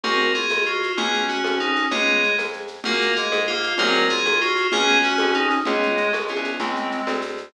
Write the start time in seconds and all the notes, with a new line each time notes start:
0.03 C2 A#3 C4 F#4 G#4 A#4, low conga, shaker
0.20 shaker
0.34 F4 G#4, shaker
0.49 D#2, high conga, shaker
0.65 F4 F#4, shaker
0.83 shaker
0.97 C#2 B3 C#4 F4 G#4, low conga, shaker
1.13 shaker
1.29 F#4, shaker
1.44 F2, high conga, shaker
1.60 D#4, shaker
1.76 shaker
1.91 C#2 G#3 B3 C#4 F4 G#4, low conga, shaker
2.07 shaker
2.23 shaker
2.38 F2, high conga, shaker
2.53 shaker
2.68 shaker
2.84 F#2 A#3 F4 F#4 G#4 A#4, low conga, shaker
3.01 shaker
3.16 G#3 G#4, shaker
3.32 G#2, high conga, shaker
3.47 A#3 F4, shaker
3.63 shaker
3.78 C2 F#3 A#3 C4 F#4 G#4 A#4, low conga, shaker
3.94 shaker
4.09 F4 G#4, shaker
4.25 D#2, high conga, shaker
4.40 F4 F#4, shaker
4.56 shaker
4.72 C#2 B3 C#4 F4 G#4, low conga, shaker
4.87 shaker
5.02 F#4, shaker
5.18 F2, high conga, shaker
5.33 D#4, shaker
5.50 shaker
5.65 C#2 G#3 B3 C#4 F4 G#4, low conga, shaker
5.82 shaker
5.97 shaker
6.13 B1, high conga, shaker
6.28 B3 C#4 F4 G#4, shaker
6.36 C2
6.44 shaker
6.60 C#2 G#3 C4, low conga, shaker
6.76 shaker
6.91 shaker
7.07 D2, high conga, shaker
7.21 shaker
7.37 shaker